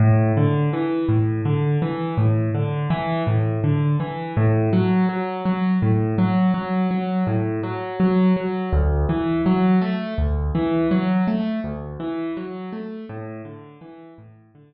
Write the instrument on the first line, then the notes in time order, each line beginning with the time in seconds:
acoustic grand piano
0.00 A2
0.37 D3
0.73 E3
1.09 A2
1.45 D3
1.82 E3
2.18 A2
2.55 D3
2.90 E3
3.27 A2
3.64 D3
4.00 E3
4.37 A2
4.73 F#3
5.09 F#3
5.45 F#3
5.82 A2
6.18 F#3
6.54 F#3
6.91 F#3
7.27 A2
7.63 F#3
8.00 F#3
8.37 F#3
8.73 D2
9.09 E3
9.46 F#3
9.82 A3
10.18 D2
10.55 E3
10.91 F#3
11.27 A3
11.64 D2
12.00 E3
12.37 F#3
12.73 A3
13.09 A2
13.45 D3
13.81 E3
14.18 A2
14.55 D3